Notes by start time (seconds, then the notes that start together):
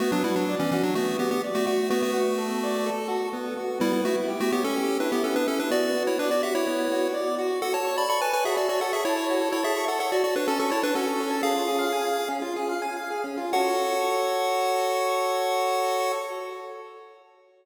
0.00 A3 B3 F#4
0.12 F#3 D4
0.24 G3 E4 F#4
0.36 F#3 D4
0.49 D5
0.60 E3 C#4
0.71 E3 C#4 F#4
0.83 F#3 D4
0.95 A3 B3 F#4
1.19 B3 F#4 G4
1.31 B3 G4
1.44 D5
1.55 A3 F#4
1.66 A3 F#4
1.90 A3 B3 F#4
2.02 A3 F#4
2.14 F#4
2.38 A4
2.63 D5
2.86 A4
3.08 F#4
3.33 B3
3.57 F#4
3.80 G3 B3 E4
3.93 G3 E4
4.05 A3 E4 F#4
4.28 G4
4.40 A3 F#4
4.52 B3 G4 C#5
4.64 C#4 A4
4.76 G4
5.00 D4 E4 B4
5.12 B3 G4
5.23 B3 C#4 A4
5.36 D4 B4
5.48 C#4 E4 A4
5.60 D4 B4
5.71 B3 F#4 D5
5.96 F#4
6.07 E4 C#5
6.19 D4 B4 D5
6.31 F#4 D5
6.43 F#4 G4 E5
6.55 E4 C#5
6.67 B3
6.91 F#4
7.14 D5
7.38 F#4
7.62 F#4 A4 F#5
7.73 A4 C#5 A5
7.85 C#5
7.96 D5 A5 B5
8.09 D5 B5 C#6
8.21 B4 G#5 A5
8.33 B4 C#5 G#5
8.45 F#4 G#4 E5
8.57 F#4 A4 D5
8.69 F#4 C#5 D5
8.81 A4 F#5 A5
8.92 G#4 E5 C#6
9.05 E4 C#5 A5
9.16 C#5
9.30 F#4
9.41 A4
9.52 E4 C#5
9.63 G#4 E5 A5
9.76 C#6
9.88 A4 F#5 A5
9.99 A4 C#5 F#5
10.12 F#4 D5
10.24 F#4 A4 D5
10.36 D4 B4 C#5
10.48 C#4 A4 A5
10.59 C#4 A4 C#6
10.70 E4 C#5 A5
10.82 D4 B4 C#5
10.95 C#4 F#4 A4
11.07 A4
11.20 C#5
11.30 A5
11.43 C#4 G#4 F5
11.54 F4
11.68 G#4
11.79 F5
11.93 G#5
12.03 F5
12.17 G#4
12.29 C#4
12.42 F4
12.56 G#4
12.69 F5
12.82 G#5
12.97 F5
13.10 G#4
13.24 C#4
13.37 F4
13.53 F#4 A4 C#5 F#5